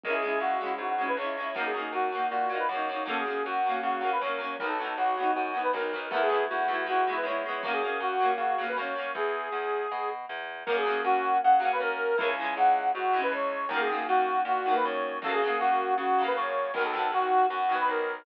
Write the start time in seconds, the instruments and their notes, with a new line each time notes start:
0.03 electric bass (finger) C#2, orchestral harp G#3 C#4, accordion A#4, kick
0.10 orchestral harp E4, accordion G#4
0.22 orchestral harp G#3 C#4
0.28 orchestral harp E4
0.40 electric bass (finger) C#2, accordion F#4
0.61 orchestral harp G#3 C#4
0.66 orchestral harp E4
0.78 electric bass (finger) G#2, accordion F#4
0.98 orchestral harp G#3 C#4
1.04 orchestral harp E4
1.08 accordion B4
1.17 electric bass (finger) C#2, orchestral harp G#3, accordion C#5
1.21 orchestral harp C#4 E4
1.38 orchestral harp G#3 C#4
1.43 orchestral harp E4
1.55 electric bass (finger) F#2, orchestral harp F#3 A#3, accordion A#4, kick
1.60 orchestral harp D#4
1.65 accordion G#4
1.74 orchestral harp F#3 A#3
1.80 orchestral harp D#4
1.93 electric bass (finger) F#2, accordion F#4
2.12 orchestral harp F#3 A#3
2.18 orchestral harp D#4
2.30 electric bass (finger) A#2, accordion F#4
2.49 orchestral harp F#3 A#3
2.55 orchestral harp D#4, accordion B4
2.69 electric bass (finger) F#2, orchestral harp F#3, accordion C#5
2.74 orchestral harp A#3 D#4
2.89 orchestral harp F#3 A#3
2.95 orchestral harp D#4
3.05 electric bass (finger) F#2, orchestral harp F#3 A#3, accordion A4, kick
3.11 orchestral harp C#4
3.18 accordion G#4
3.25 orchestral harp F#3 A#3
3.30 orchestral harp C#4
3.45 electric bass (finger) F#2, accordion F#4
3.66 orchestral harp F#3 A#3
3.71 orchestral harp C#4
3.83 electric bass (finger) C#3, accordion F#4
4.01 orchestral harp F#3 A#3
4.06 orchestral harp C#4
4.12 accordion B4
4.21 electric bass (finger) F#2, orchestral harp F#3 A#3, accordion C#5
4.27 orchestral harp C#4
4.38 orchestral harp F#3 A#3
4.44 orchestral harp C#4
4.59 electric bass (finger) B1, orchestral harp F#3, accordion A#4, kick
4.63 orchestral harp B3 D#4
4.68 accordion A4
4.79 orchestral harp F#3 B3
4.84 orchestral harp D#4
4.97 electric bass (finger) B1, accordion F#4
5.17 orchestral harp F#3 B3
5.23 orchestral harp D#4
5.35 electric bass (finger) F#2, accordion F#4
5.54 orchestral harp F#3 B3
5.59 orchestral harp D#4, accordion B4
5.73 electric bass (finger) B1, orchestral harp F#3 B3, accordion A#4
5.80 orchestral harp D#4
5.93 orchestral harp F#3 B3
5.98 orchestral harp D#4
6.11 electric bass (finger) E2, orchestral harp A3 B3, accordion A#4, kick
6.16 orchestral harp E4
6.21 accordion G#4
6.29 orchestral harp A3 B3
6.34 orchestral harp E4
6.49 electric bass (finger) E2, accordion F#4
6.68 electric bass (finger) E2, orchestral harp A3 B3
6.74 orchestral harp E4
6.86 orchestral harp G#3 B3, accordion F#4
6.92 orchestral harp E4
7.07 orchestral harp G#3 B3
7.12 orchestral harp E4, accordion B4
7.23 electric bass (finger) E2, orchestral harp G#3, accordion C#5
7.28 orchestral harp B3 E4
7.46 orchestral harp G#3 B3
7.51 orchestral harp E4
7.63 electric bass (finger) F#2, orchestral harp F#3 A#3, accordion A#4, kick
7.68 orchestral harp C#4
7.72 accordion G#4
7.82 orchestral harp F#3 A#3
7.87 orchestral harp C#4
8.00 electric bass (finger) F#2, accordion F#4
8.20 orchestral harp F#3 A#3
8.25 orchestral harp C#4
8.38 electric bass (finger) C#3, accordion F#4
8.58 orchestral harp F#3 A#3
8.64 orchestral harp C#4
8.68 accordion B4
8.76 electric bass (finger) F#2, orchestral harp F#3 A#3, accordion C#5
8.82 orchestral harp C#4
8.96 orchestral harp F#3 A#3
9.01 orchestral harp C#4
9.15 electric bass (finger) E2, accordion G#4, kick
9.52 electric bass (finger) E2
9.92 electric bass (finger) B2
10.29 electric bass (finger) E2
10.66 electric bass (finger) F#2, orchestral harp F#3 A#3, accordion A#4, kick
10.72 orchestral harp C#4
10.77 accordion G#4
10.85 orchestral harp F#3 A#3
10.90 orchestral harp C#4
11.04 electric bass (finger) F#2, accordion F#4
11.43 electric bass (finger) C#3, accordion F#5
11.60 orchestral harp F#3 A#3
11.65 orchestral harp C#4
11.72 accordion B4
11.80 electric bass (finger) F#2, accordion A#4
12.18 electric bass (finger) C#2, orchestral harp E3 G#3, accordion A#4, kick
12.23 orchestral harp C#4
12.28 accordion G#5
12.39 orchestral harp E3 G#3
12.45 orchestral harp C#4
12.57 electric bass (finger) C#2, accordion F#5
12.94 electric bass (finger) G#2, accordion F#4
13.13 orchestral harp E3 G#3
13.19 orchestral harp C#4
13.23 accordion B4
13.31 electric bass (finger) C#2, accordion C#5
13.69 electric bass (finger) F#2, orchestral harp D#3, accordion A#4, kick
13.73 orchestral harp F#3 A#3
13.80 accordion G#4
13.89 orchestral harp D#3 F#3
13.94 orchestral harp A#3
14.08 electric bass (finger) F#2, accordion F#4
14.45 electric bass (finger) A#2, accordion F#4
14.66 orchestral harp D#3 F#3
14.71 orchestral harp A#3, accordion B4
14.84 electric bass (finger) F#2, accordion C#5
15.22 electric bass (finger) F#2, orchestral harp C#3, accordion A4, kick
15.26 orchestral harp F#3 A#3
15.33 accordion G#4
15.42 orchestral harp C#3 F#3
15.47 orchestral harp A#3
15.60 electric bass (finger) F#2, accordion F#4
15.98 electric bass (finger) C#3, accordion F#4
16.18 orchestral harp C#3 F#3
16.24 orchestral harp A#3, accordion B4
16.36 electric bass (finger) F#2, accordion C#5
16.74 electric bass (finger) B1, orchestral harp D#3, accordion A#4, kick
16.79 orchestral harp F#3 B3
16.85 accordion A4
16.94 orchestral harp D#3 F#3
16.99 orchestral harp B3
17.12 electric bass (finger) B1, accordion F#4
17.50 electric bass (finger) F#2, accordion F#4
17.69 orchestral harp D#3 F#3
17.74 orchestral harp B3
17.80 accordion B4
17.88 electric bass (finger) B1, accordion A#4